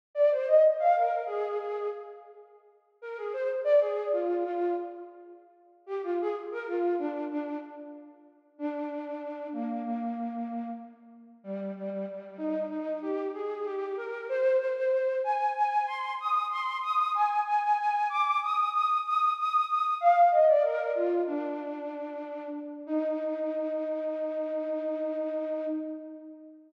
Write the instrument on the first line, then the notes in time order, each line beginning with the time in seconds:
flute
0.15 D5
0.31 C5
0.48 D#5
0.79 F5
0.96 A#4
1.26 G#4
1.58 G#4
3.02 A#4
3.17 G#4
3.33 C5
3.64 D5
3.80 G#4
4.12 F4
4.44 F4
5.86 G4
6.03 F4
6.21 G#4
6.51 A#4
6.68 F4
6.99 D4
7.30 D4
8.58 D4
9.52 A#3
9.83 A#3
11.44 G3
11.76 G3
11.90 G3
12.08 G3
12.38 D#4
12.70 D#4
13.02 G4
13.34 G#4
13.65 G4
13.97 A#4
14.29 C5
14.59 C5
14.76 C5
14.92 C5
15.24 G#5
15.56 G#5
15.87 C6
16.20 D#6
16.51 C6
16.82 D#6
17.14 G#5
17.46 G#5
17.62 G#5
17.78 G#5
18.09 D6
18.42 D#6
18.72 D#6
19.04 D#6
19.38 D#6
19.68 D#6
20.01 F5
20.31 D#5
20.47 D5
20.63 A#4
20.95 F4
21.27 D4
22.86 D#4